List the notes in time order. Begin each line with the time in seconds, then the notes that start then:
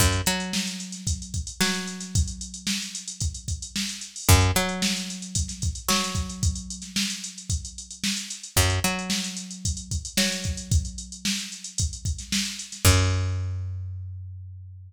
0.00 F#2, kick, closed hi-hat
0.12 closed hi-hat
0.26 F#3, snare, closed hi-hat
0.40 closed hi-hat
0.53 snare
0.67 snare, closed hi-hat
0.80 closed hi-hat
0.92 snare, closed hi-hat
1.07 kick, closed hi-hat
1.22 closed hi-hat
1.34 kick, closed hi-hat
1.47 closed hi-hat
1.60 F#3, snare
1.74 closed hi-hat
1.87 closed hi-hat
2.00 snare, closed hi-hat
2.15 kick, closed hi-hat
2.28 closed hi-hat
2.41 closed hi-hat
2.54 closed hi-hat
2.67 snare
2.82 closed hi-hat
2.95 closed hi-hat
3.08 closed hi-hat
3.20 kick, closed hi-hat
3.34 closed hi-hat
3.48 kick, closed hi-hat
3.62 closed hi-hat
3.76 snare
3.89 closed hi-hat
4.01 closed hi-hat
4.16 open hi-hat
4.29 F#2, kick, closed hi-hat
4.41 closed hi-hat
4.55 F#3, snare, closed hi-hat
4.69 closed hi-hat
4.82 snare
4.97 closed hi-hat
5.08 snare, closed hi-hat
5.22 closed hi-hat
5.35 kick, closed hi-hat
5.48 snare, closed hi-hat
5.62 kick, closed hi-hat
5.75 closed hi-hat
5.89 F#3, snare
6.03 snare, closed hi-hat
6.15 kick, closed hi-hat
6.29 closed hi-hat
6.43 kick, closed hi-hat
6.55 closed hi-hat
6.70 closed hi-hat
6.82 snare, closed hi-hat
6.96 snare
7.10 closed hi-hat
7.24 closed hi-hat
7.38 closed hi-hat
7.50 kick, closed hi-hat
7.65 closed hi-hat
7.78 closed hi-hat
7.91 closed hi-hat
8.04 snare
8.17 closed hi-hat
8.30 closed hi-hat
8.43 closed hi-hat
8.56 F#2, kick, closed hi-hat
8.70 closed hi-hat
8.84 F#3, closed hi-hat
8.99 closed hi-hat
9.10 snare
9.24 closed hi-hat
9.37 closed hi-hat
9.51 closed hi-hat
9.65 kick, closed hi-hat
9.77 closed hi-hat
9.91 kick, closed hi-hat
10.05 closed hi-hat
10.17 F#3, snare
10.32 closed hi-hat
10.44 kick, closed hi-hat
10.57 closed hi-hat
10.71 kick, closed hi-hat
10.85 closed hi-hat
10.98 closed hi-hat
11.12 closed hi-hat
11.25 snare
11.39 closed hi-hat
11.52 closed hi-hat
11.64 closed hi-hat
11.78 kick, closed hi-hat
11.93 closed hi-hat
12.05 kick, closed hi-hat
12.19 snare, closed hi-hat
12.32 snare
12.45 closed hi-hat
12.59 closed hi-hat
12.72 snare, closed hi-hat
12.85 F#2, kick, crash